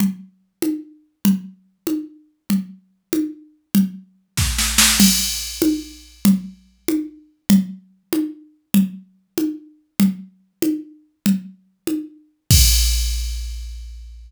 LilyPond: \new DrumStaff \drummode { \time 6/8 \tempo 4. = 96 cgl4. cgho4. | cgl4. cgho4. | cgl4. cgho4. | cgl4. <bd sn>8 sn8 sn8 |
<cgl cymc>4. cgho4. | cgl4. cgho4. | cgl4. cgho4. | cgl4. cgho4. |
cgl4. cgho4. | cgl4. cgho4. | <cymc bd>4. r4. | }